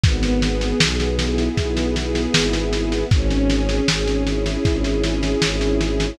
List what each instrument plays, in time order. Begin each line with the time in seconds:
0.04 violin G#1, string ensemble 1 B3, kick, snare
0.23 snare
0.42 string ensemble 1 G#4, snare
0.61 snare
0.80 violin B1, string ensemble 1 B3, snare
1.00 snare
1.18 string ensemble 1 E4, snare
1.38 snare
1.57 violin B1, string ensemble 1 B3, kick, snare
1.77 snare
1.95 string ensemble 1 G#4, snare
2.15 snare
2.34 violin G#1, string ensemble 1 E4, snare
2.53 snare
2.73 string ensemble 1 B3, snare
2.92 snare
3.11 violin G#1, string ensemble 1 C#4, kick, snare
3.30 snare
3.49 string ensemble 1 G#4, snare
3.69 snare
3.88 violin G#1, string ensemble 1 C#4, snare
4.08 snare
4.26 string ensemble 1 E4, snare
4.46 snare
4.65 violin G#1, string ensemble 1 C#4, kick, snare
4.84 snare
5.04 string ensemble 1 G#4, snare
5.23 snare
5.42 violin G#1, string ensemble 1 E4, snare
5.61 snare
5.80 string ensemble 1 C#4, snare
6.00 snare